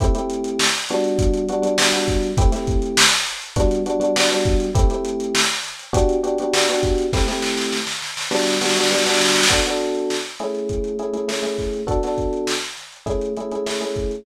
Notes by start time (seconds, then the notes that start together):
0.00 A3 C4 E4 G4, kick, closed hi-hat
0.15 A3 C4 E4 G4, closed hi-hat
0.30 closed hi-hat
0.44 closed hi-hat
0.59 snare
0.74 closed hi-hat
0.89 G3 B3 D4 F#4, closed hi-hat
1.04 closed hi-hat
1.19 kick, closed hi-hat
1.34 closed hi-hat
1.49 G3 B3 D4 F#4, closed hi-hat
1.62 G3 B3 D4 F#4, closed hi-hat
1.78 G3 B3 D4 F#4, snare
1.93 G3 B3 D4 F#4, closed hi-hat
2.08 kick, snare, closed hi-hat
2.23 closed hi-hat
2.37 A3 C4 E4 G4, kick, closed hi-hat
2.52 A3 C4 E4 G4, snare, closed hi-hat
2.67 kick, closed hi-hat
2.82 closed hi-hat
2.97 snare
3.12 closed hi-hat
3.27 snare, closed hi-hat
3.42 closed hi-hat
3.56 G3 B3 D4 F#4, kick, closed hi-hat
3.71 closed hi-hat
3.86 G3 B3 D4 F#4, closed hi-hat
4.00 G3 B3 D4 F#4, closed hi-hat
4.16 G3 B3 D4 F#4, snare
4.31 G3 B3 D4 F#4, closed hi-hat
4.45 kick, closed hi-hat
4.60 closed hi-hat
4.75 A3 C4 E4 G4, kick, closed hi-hat
4.90 A3 C4 E4 G4, closed hi-hat
5.05 closed hi-hat
5.20 closed hi-hat
5.35 snare
5.50 closed hi-hat
5.64 snare, closed hi-hat
5.79 closed hi-hat
5.93 B3 D4 F#4 G4, kick, closed hi-hat
6.09 closed hi-hat
6.23 B3 D4 F#4 G4, closed hi-hat
6.38 B3 D4 F#4 G4, closed hi-hat
6.53 B3 D4 F#4 G4, snare
6.68 B3 D4 F#4 G4, closed hi-hat
6.83 kick, closed hi-hat
6.98 closed hi-hat
7.13 A3 C4 E4 G4, kick, snare
7.28 A3 C4 E4 G4, snare
7.42 snare
7.57 snare
7.72 snare
7.87 snare
8.02 snare
8.17 snare
8.31 G3 B3 D4 F#4, snare
8.39 snare
8.47 snare
8.54 snare
8.61 G3 B3 D4 F#4, snare
8.69 snare
8.76 G3 B3 D4 F#4, snare
8.83 snare
8.91 G3 B3 D4 F#4, snare
8.98 snare
9.06 G3 B3 D4 F#4, snare
9.14 snare
9.21 snare
9.28 snare
9.36 snare
9.43 snare
9.49 B3 D4 F#4 A4, kick, closed hi-hat
9.65 B3 D4 F#4 A4, closed hi-hat
9.80 closed hi-hat
9.95 closed hi-hat
10.10 snare
10.25 closed hi-hat
10.39 A3 C#4 E4 G#4, closed hi-hat
10.55 closed hi-hat
10.69 kick, closed hi-hat
10.84 closed hi-hat
10.99 A3 C#4 E4 G#4, closed hi-hat
11.13 A3 C#4 E4 G#4, closed hi-hat
11.28 A3 C#4 E4 G#4, snare
11.43 A3 C#4 E4 G#4, closed hi-hat
11.58 kick, snare, closed hi-hat
11.74 closed hi-hat
11.87 B3 D4 F#4 A4, kick, closed hi-hat
12.03 B3 D4 F#4 A4, snare, closed hi-hat
12.18 kick, closed hi-hat
12.33 closed hi-hat
12.47 snare
12.62 closed hi-hat
12.77 snare, closed hi-hat
12.92 closed hi-hat
13.06 A3 C#4 E4 G#4, kick, closed hi-hat
13.21 closed hi-hat
13.37 A3 C#4 E4 G#4, closed hi-hat
13.51 A3 C#4 E4 G#4, closed hi-hat
13.66 A3 C#4 E4 G#4, snare
13.81 A3 C#4 E4 G#4, closed hi-hat
13.96 kick, closed hi-hat
14.11 closed hi-hat